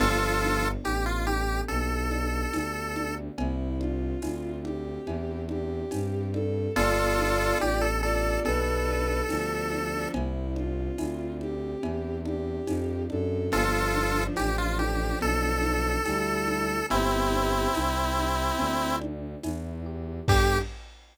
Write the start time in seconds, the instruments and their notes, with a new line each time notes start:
0.00 violin G1 F3 D4, electric piano 1 B3, lead 1 (square) F4 A4, crash, cowbell, low conga
0.42 electric piano 1 D4, high conga
0.84 violin A1, electric piano 1 G4, lead 1 (square) G4, tambourine, cowbell, high conga
1.06 lead 1 (square) F4
1.26 lead 1 (square) G4, electric piano 1 A4, high conga
1.68 violin B1, electric piano 1 G4, lead 1 (square) A4, cowbell, low conga
2.11 electric piano 1 D4, high conga
2.53 violin D2, electric piano 1 B3, tambourine, cowbell, high conga
2.96 electric piano 1 D4, high conga
3.38 violin C2 E4, electric piano 1 C4, cowbell, low conga
3.80 electric piano 1 D4, violin F4, high conga
4.22 violin D2, electric piano 1 E4, tambourine, cowbell, high conga
4.64 violin G4, electric piano 1 G4, high conga
5.07 violin E2, electric piano 1 E4, cowbell, low conga
5.49 electric piano 1 D4, violin G4, high conga
5.91 violin G2, electric piano 1 C4, tambourine, cowbell, high conga
6.34 electric piano 1 D4, violin A4, high conga
6.76 violin G1 F4 D5, electric piano 1 B3, lead 1 (square) F4 A4, cowbell, low conga
7.18 electric piano 1 D4, high conga
7.60 violin A1, electric piano 1 G4, lead 1 (square) G4, tambourine, cowbell, high conga
7.81 lead 1 (square) A4
8.02 violin F4 D5, lead 1 (square) A4, electric piano 1 A4
8.45 violin B1 D4 B4, electric piano 1 G4, lead 1 (square) A4, cowbell, low conga
8.88 electric piano 1 D4
9.29 violin D2 F3 D4, electric piano 1 B3, tambourine, cowbell, high conga
9.71 electric piano 1 D4, high conga
9.93 violin F3 D4
10.14 violin C2 E4, electric piano 1 C4, cowbell, low conga
10.56 electric piano 1 D4, violin F4, high conga
10.98 violin D2, electric piano 1 E4, tambourine, cowbell, high conga
11.41 violin G4, electric piano 1 G4, high conga
11.83 violin E2, electric piano 1 E4, cowbell, low conga
12.26 electric piano 1 D4, violin G4, high conga
12.67 violin F2, electric piano 1 C4, tambourine, cowbell, high conga
13.10 violin F#2 A4, electric piano 1 D4, high conga
13.52 violin G1 F3 D4, electric piano 1 B3, lead 1 (square) F4 A4, cowbell, low conga
13.94 electric piano 1 D4, high conga
14.36 violin A1, electric piano 1 G4, lead 1 (square) G4, tambourine, cowbell, high conga
14.58 lead 1 (square) F4
14.79 lead 1 (square) G4, electric piano 1 A4, high conga
15.21 violin B1, electric piano 1 B3, lead 1 (square) A4, cowbell, low conga
15.63 electric piano 1 D4, high conga
16.05 violin D2 G3 E4, electric piano 1 G4, tambourine, cowbell, high conga
16.48 electric piano 1 A4, high conga
16.90 violin G1 B3 G4, electric piano 1 C4, lead 1 (square) C4 E4, cowbell, low conga
17.32 electric piano 1 D4, high conga
17.74 violin C2, electric piano 1 E4, tambourine, cowbell, high conga
18.17 electric piano 1 G4, high conga
18.59 violin D2, electric piano 1 C4, cowbell, low conga
19.01 electric piano 1 D4, high conga
19.43 violin E2, electric piano 1 E4, tambourine, cowbell, high conga
19.86 electric piano 1 G4
20.28 violin G2 G4, electric piano 1 B3 D4 G4 A4, lead 1 (square) G4, kick, crash